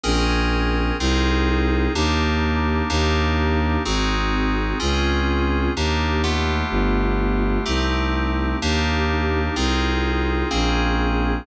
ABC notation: X:1
M:3/4
L:1/8
Q:1/4=63
K:Ebmix
V:1 name="Electric Piano 2"
[CDAB]2 [CEFA]2 [B,=DEG]2 | [B,=DEG]2 [CE_GA]2 [C_DFA]2 | [B,=DEG] [=A,=B,FG]3 [A,CEG]2 | [B,=DEG]2 [CEFA]2 [B,C_DA]2 |]
V:2 name="Violin" clef=bass
B,,,2 C,,2 E,,2 | E,,2 A,,,2 D,,2 | E,,2 G,,,2 C,,2 | E,,2 C,,2 B,,,2 |]